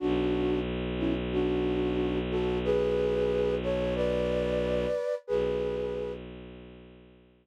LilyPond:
<<
  \new Staff \with { instrumentName = "Flute" } { \time 4/4 \key b \dorian \tempo 4 = 91 <d' fis'>4 r8 <cis' e'>16 r16 <d' fis'>4. <fis' a'>8 | <gis' b'>4. <a' cis''>8 <b' d''>2 | <gis' b'>4. r2 r8 | }
  \new Staff \with { instrumentName = "Violin" } { \clef bass \time 4/4 \key b \dorian b,,1~ | b,,1 | b,,1 | }
>>